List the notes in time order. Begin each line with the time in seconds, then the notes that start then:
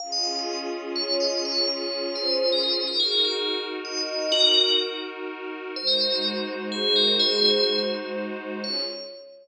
0.00 C#4 F4 G#4 F5
0.12 D#5
0.24 F5
0.36 D#5
0.96 C#5
1.20 D#5
1.45 C#5
1.68 C#5
2.15 C5
2.52 A#4
2.63 C5
2.87 D#4 F#4 A#4
3.00 G#4
3.12 A#4
3.25 G#4
3.85 D#5
4.09 D#5
4.32 F#4 A#4
5.76 G#3 D#4 F#4 C5
5.87 A#4
6.01 C5
6.12 A#4
6.72 G#4
6.96 A#4
7.19 G#4 C5
8.64 C#4 F4 G#4 C#5